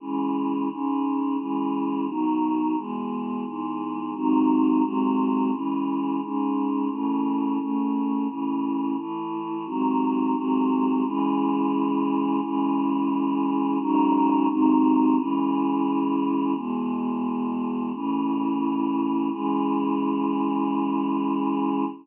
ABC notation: X:1
M:4/4
L:1/8
Q:1/4=87
K:C#m
V:1 name="Choir Aahs"
[C,E,G,]2 [G,,C,G,]2 [C,E,G,]2 [B,,D,F,]2 | [E,,B,,G,]2 [E,,G,,G,]2 [G,,^B,,D,F,]2 [G,,B,,F,G,]2 | [C,E,G,]2 [G,,C,G,]2 [C,E,A,]2 [A,,C,A,]2 | [A,,C,E,]2 [A,,E,A,]2 [G,,^B,,D,F,]2 [G,,B,,F,G,]2 |
[C,E,G,]4 [C,E,G,]4 | [G,,C,D,F,]2 [G,,^B,,D,F,]2 [C,E,G,]4 | [E,,B,,G,]4 [A,,C,E,]4 | [C,E,G,]8 |]